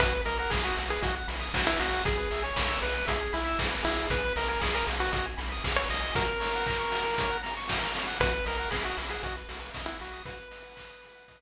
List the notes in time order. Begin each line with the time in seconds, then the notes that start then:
0.00 B1 F#4 B4, kick, closed hi-hat
0.12 B4
0.25 B1 A#4 D#5, open hi-hat
0.39 A#4 F#5
0.50 B1 G#4 B5, kick, snare
0.64 F#4 D#6
0.77 B1 F#4, open hi-hat
0.90 G#4 B4
1.01 B1 F#4 D#5, kick, closed hi-hat
1.16 F#5
1.28 B1 B5, open hi-hat
1.40 D#6
1.54 B1 F#4, kick, snare
1.67 E4 B4
1.79 B1 F#4 D#5, snare, open hi-hat
1.93 F#5
2.05 B1 G#4, kick, closed hi-hat
2.18 B4
2.31 B1 E5, open hi-hat
2.42 C#5 G#5
2.56 B1 B5, kick, snare
2.68 E6
2.81 B1 G#4 B4, open hi-hat
2.95 B4
3.07 B1 G#4 E5, kick, closed hi-hat
3.21 G#5
3.33 B1 E4 B5, open hi-hat
3.47 E6
3.59 B1 G#4, kick, snare
3.71 B4
3.83 B1 E4 G#4, snare, open hi-hat
4.10 B1 B4, kick, closed hi-hat
4.25 B4
4.36 B1 A#4 D#5, open hi-hat
4.48 A#4 G#5
4.61 B1 G#4 B5, kick, snare
4.73 A#4 D#6
4.87 B1 G#4, open hi-hat
5.00 F#4 B4
5.12 B1 F#4 D#5, kick, closed hi-hat
5.26 G#5
5.38 B1 B5, open hi-hat
5.52 D#6
5.64 B1 G#4, kick, snare
5.76 B4 C#5
5.90 B1 D#5, snare, open hi-hat
6.01 G#5
6.15 F#4 A#4, kick, closed hi-hat
6.28 A#4
6.40 C#5, open hi-hat
6.55 F#5
6.66 A#5, kick, clap
6.79 C#6
6.92 F#4, open hi-hat
7.04 A#4
7.18 C#5, kick, closed hi-hat
7.30 F#5
7.43 A#5, open hi-hat
7.57 C#6
7.68 F#4, kick, snare
7.81 A#4
7.95 C#5, snare, open hi-hat
8.07 F#5
8.20 B1 F#4 B4, kick, closed hi-hat
8.34 B4
8.46 B1 A#4 D#5, open hi-hat
8.57 A#4 F#5
8.70 B1 G#4 B5, kick, snare
8.84 F#4 D#6
8.97 B1 B5, open hi-hat
9.10 G#4 F#5
9.23 B1 F#4 D#5, kick, closed hi-hat
9.37 B4
9.49 B1 F#4, open hi-hat
9.60 B4
9.74 B1 D#5, kick, snare
9.86 E4 F#5
10.00 B1 F#4 B5, snare, open hi-hat
10.13 D#6
10.25 F#4 B4, kick, closed hi-hat
10.36 B4
10.51 D#5, open hi-hat
10.65 F#5
10.76 B5, kick, clap
10.90 D#6
11.02 B5, open hi-hat
11.15 F#5
11.28 D#5, kick, closed hi-hat
11.40 B4